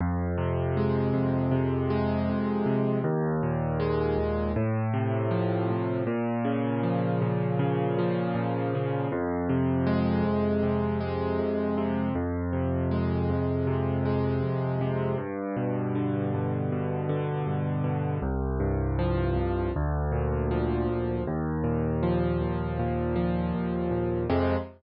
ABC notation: X:1
M:4/4
L:1/8
Q:1/4=79
K:Fm
V:1 name="Acoustic Grand Piano" clef=bass
F,, C, A, F,, C, A, F,, C, | E,, B,, A, E,, =A,, C, F, A,, | B,, D, F, B,, D, F, B,, D, | F,, C, A, F,, C, A, F,, C, |
F,, C, A, F,, C, A, F,, C, | G,, =B,, =D, G,, B,, D, G,, B,, | C,, G,, F, C,, =D,, B,, F, D,, | E,, B,, F, E,, B,, F, E,, B,, |
[F,,C,A,]2 z6 |]